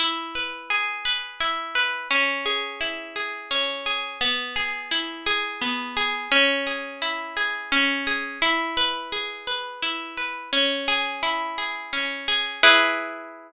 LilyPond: \new Staff { \time 6/8 \key e \major \tempo 4. = 57 e'8 b'8 gis'8 b'8 e'8 b'8 | cis'8 gis'8 e'8 gis'8 cis'8 gis'8 | b8 gis'8 e'8 gis'8 b8 gis'8 | cis'8 gis'8 e'8 gis'8 cis'8 gis'8 |
e'8 b'8 gis'8 b'8 e'8 b'8 | cis'8 gis'8 e'8 gis'8 cis'8 gis'8 | <e' gis' b'>2. | }